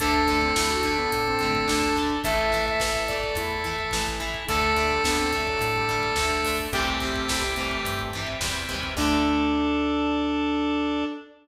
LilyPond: <<
  \new Staff \with { instrumentName = "Lead 1 (square)" } { \time 4/4 \key d \mixolydian \tempo 4 = 107 a'1 | a'1 | a'1 | g'2~ g'8 r4. |
d'1 | }
  \new Staff \with { instrumentName = "Lead 1 (square)" } { \time 4/4 \key d \mixolydian d'8. c'16 e'16 fis'16 d'16 b16 r16 c'8. d'4 | e''8. e''8. d''8 e'8 r4. | a8. g16 b16 c'16 a16 fis16 r16 g8. a4 | <a c'>4. a4 r4. |
d'1 | }
  \new Staff \with { instrumentName = "Overdriven Guitar" } { \time 4/4 \key d \mixolydian <d a>8 <d a>8 <d a>8 <d a>4 <d a>8 <d a>8 <d a>8 | <e a>8 <e a>8 <e a>8 <e a>4 <e a>8 <e a>8 <e a>8 | <d a>8 <d a>8 <d a>8 <d a>4 <d a>8 <d a>8 <d a>8 | <c e g>8 <c e g>8 <c e g>8 <c e g>4 <c e g>8 <c e g>8 <c e g>8 |
<d a>1 | }
  \new Staff \with { instrumentName = "Drawbar Organ" } { \time 4/4 \key d \mixolydian <d' a'>1 | <e' a'>1 | <d' a'>1 | r1 |
<d' a'>1 | }
  \new Staff \with { instrumentName = "Electric Bass (finger)" } { \clef bass \time 4/4 \key d \mixolydian d,4 d,4 a,4 d,4 | a,,4 a,,4 e,4 a,,4 | d,4 d,4 a,4 d,4 | c,4 c,4 g,4 e,8 dis,8 |
d,1 | }
  \new Staff \with { instrumentName = "Drawbar Organ" } { \time 4/4 \key d \mixolydian <d'' a''>1 | <e'' a''>1 | <d'' a''>1 | <c'' e'' g''>1 |
<d' a'>1 | }
  \new DrumStaff \with { instrumentName = "Drums" } \drummode { \time 4/4 <hh bd>16 bd16 <hh bd sn>16 bd16 <bd sn>16 bd16 <hh bd>16 bd16 <hh bd>16 bd16 <hh bd>16 bd16 <bd sn>16 bd16 <hh bd>16 bd16 | <hh bd>16 bd16 <hh bd sn>16 bd16 <bd sn>16 bd16 <hh bd>16 bd16 <hh bd>16 bd16 <hh bd>16 bd16 <bd sn>16 bd16 <hh bd>16 bd16 | <hh bd>16 bd16 <hh bd sn>16 bd16 <bd sn>16 bd16 <hh bd>16 bd16 <hh bd>16 bd16 <hh bd>16 bd16 <bd sn>16 bd16 <hho bd>16 bd16 | <hh bd>16 bd16 <hh bd sn>16 bd16 <bd sn>16 bd16 <hh bd>16 bd16 <hh bd>16 bd16 <hh bd>16 bd16 <bd sn>16 bd16 <hh bd>16 bd16 |
<cymc bd>4 r4 r4 r4 | }
>>